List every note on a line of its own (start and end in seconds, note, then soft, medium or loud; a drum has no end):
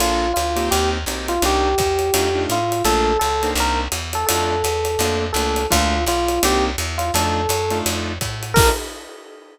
0.00 0.33 A#1 medium
0.00 0.26 A#3 loud
0.00 0.26 D4 loud
0.00 0.26 F4 loud
0.00 0.32 F4 medium
0.00 0.26 A4 loud
0.00 ride loud
0.34 0.69 D2 medium
0.34 0.68 F4 medium
0.34 hi-hat pedal medium
0.34 ride medium
0.56 0.98 A#3 loud
0.56 0.98 C4 loud
0.56 0.98 D#4 loud
0.56 0.98 G4 loud
0.56 ride medium
0.71 1.05 D#2 medium
0.71 0.90 G4 medium
0.71 ride medium
1.06 1.39 B1 medium
1.06 1.34 A#3 loud
1.06 1.34 C4 medium
1.06 1.34 D#4 loud
1.06 1.34 G4 loud
1.06 hi-hat pedal medium
1.06 ride medium
1.28 1.42 F4 medium
1.28 ride medium
1.42 1.75 C2 medium
1.42 1.70 A#3 loud
1.42 1.70 C4 loud
1.42 1.70 D4 loud
1.42 1.70 D#4 loud
1.42 2.42 G4 medium
1.42 ride medium
1.78 2.11 E2 medium
1.78 kick medium
1.78 hi-hat pedal medium
1.78 ride medium
1.99 ride medium
2.14 2.47 F2 medium
2.14 2.28 A3 loud
2.14 2.28 D4 loud
2.14 2.28 D#4 loud
2.14 2.28 F4 loud
2.14 ride loud
2.35 2.58 A3 loud
2.35 2.58 D4 loud
2.35 2.58 D#4 loud
2.35 2.58 F4 loud
2.49 2.82 A2 medium
2.49 2.83 F4 medium
2.49 hi-hat pedal medium
2.49 ride medium
2.72 ride medium
2.84 3.17 A#1 medium
2.84 3.12 A3 loud
2.84 3.12 A#3 loud
2.84 3.12 D4 loud
2.84 3.12 F4 loud
2.84 3.18 A4 medium
2.84 ride medium
3.19 3.54 C#2 medium
3.19 3.50 A4 medium
3.19 hi-hat pedal medium
3.19 ride medium
3.43 3.85 A#3 loud
3.43 3.85 C4 loud
3.43 3.85 D4 loud
3.43 3.85 D#4 loud
3.43 ride medium
3.55 3.88 C2 medium
3.55 ride medium
3.60 3.80 A#4 medium
3.92 4.25 E2 medium
3.92 hi-hat pedal medium
3.92 ride medium
4.13 4.26 A4 medium
4.13 ride medium
4.27 4.63 F2 medium
4.27 4.55 A3 loud
4.27 4.55 D4 loud
4.27 4.55 D#4 loud
4.27 4.55 F4 loud
4.27 5.25 A4 medium
4.27 ride loud
4.64 4.97 E2 medium
4.64 hi-hat pedal medium
4.64 ride medium
4.85 ride medium
4.99 5.32 F2 medium
4.99 5.27 A3 loud
4.99 5.27 A#3 loud
4.99 5.27 D4 loud
4.99 5.27 F4 loud
4.99 ride medium
5.33 5.67 C#2 medium
5.33 5.62 A3 medium
5.33 5.62 A#3 loud
5.33 5.62 D4 loud
5.33 5.62 F4 loud
5.33 5.66 A4 medium
5.33 hi-hat pedal medium
5.33 ride medium
5.56 ride medium
5.71 6.05 D2 loud
5.71 5.97 A3 loud
5.71 5.97 A#3 loud
5.71 5.97 D4 loud
5.71 5.97 F4 loud
5.71 6.04 F4 medium
5.71 kick medium
5.71 ride loud
6.06 6.39 B1 medium
6.06 6.41 F4 medium
6.06 hi-hat pedal medium
6.06 ride medium
6.28 ride medium
6.43 6.76 C2 medium
6.43 6.70 A#3 loud
6.43 6.70 C4 loud
6.43 6.70 D4 loud
6.43 6.70 D#4 loud
6.43 6.64 G4 medium
6.43 ride loud
6.78 7.11 E2 medium
6.78 hi-hat pedal medium
6.78 ride medium
6.98 7.12 F4 medium
6.98 ride medium
7.14 7.47 F2 medium
7.14 7.42 A3 loud
7.14 7.42 D4 loud
7.14 7.42 D#4 loud
7.14 7.42 F4 loud
7.14 7.78 A4 medium
7.14 ride loud
7.49 7.82 F#2 medium
7.49 hi-hat pedal medium
7.49 ride medium
7.70 8.13 A3 loud
7.70 8.13 D4 loud
7.70 8.13 D#4 loud
7.70 8.13 F4 loud
7.70 ride medium
7.86 8.19 F2 medium
7.86 ride loud
8.21 8.54 A2 medium
8.21 kick medium
8.21 hi-hat pedal medium
8.21 ride medium
8.43 ride medium
8.54 8.70 A#1 loud
8.54 8.71 A#3 medium
8.54 8.71 D4 loud
8.54 8.71 F4 loud
8.54 8.71 A4 loud
8.54 8.69 A#4 loud
8.54 kick loud
8.54 crash loud